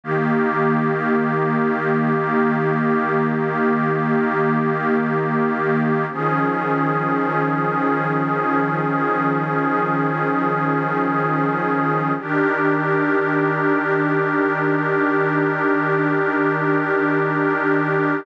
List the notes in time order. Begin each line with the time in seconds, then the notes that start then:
0.04 D#3 A#3 G4
6.11 D#3 F3 C#4 G#4
12.19 D#3 D4 G4 A#4